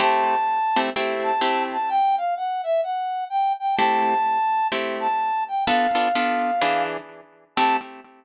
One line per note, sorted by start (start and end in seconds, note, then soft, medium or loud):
0.00 0.35 A3 medium
0.00 0.35 C4 loud
0.00 0.35 E4 loud
0.00 0.35 G4 loud
0.00 0.80 A5 loud
0.76 0.90 A3 medium
0.76 0.90 C4 loud
0.76 0.90 E4 medium
0.76 0.90 G4 medium
0.96 1.32 A3 medium
0.96 1.32 C4 medium
0.96 1.32 E4 loud
0.96 1.32 G4 loud
1.23 1.63 A5 medium
1.41 1.77 A3 medium
1.41 1.77 C4 medium
1.41 1.77 E4 medium
1.41 1.77 G4 medium
1.72 1.90 A5 medium
1.89 2.16 G5 loud
2.18 2.35 F5 medium
2.37 2.62 F#5 medium
2.63 2.81 E5 medium
2.83 3.24 F#5 medium
3.30 3.53 G5 medium
3.59 3.75 G5 medium
3.76 4.14 A3 loud
3.76 4.14 C4 loud
3.76 4.14 E4 loud
3.76 4.14 G4 loud
3.76 4.67 A5 loud
4.72 5.08 A3 medium
4.72 5.08 C4 medium
4.72 5.08 E4 medium
4.72 5.08 G4 medium
5.00 5.44 A5 medium
5.48 5.64 G5 medium
5.66 5.87 B3 loud
5.66 5.87 D4 loud
5.66 5.87 F4 loud
5.66 5.87 A4 loud
5.66 6.83 F5 medium
5.95 6.08 B3 medium
5.95 6.08 D4 medium
5.95 6.08 F4 medium
5.95 6.08 A4 medium
6.15 6.51 B3 medium
6.15 6.51 D4 medium
6.15 6.51 F4 medium
6.15 6.51 A4 medium
6.62 6.97 E3 loud
6.62 6.97 D4 loud
6.62 6.97 G#4 loud
6.62 6.97 B4 loud
7.56 7.77 A3 loud
7.56 7.77 C4 loud
7.56 7.77 E4 medium
7.56 7.77 G4 loud
7.56 7.76 A5 loud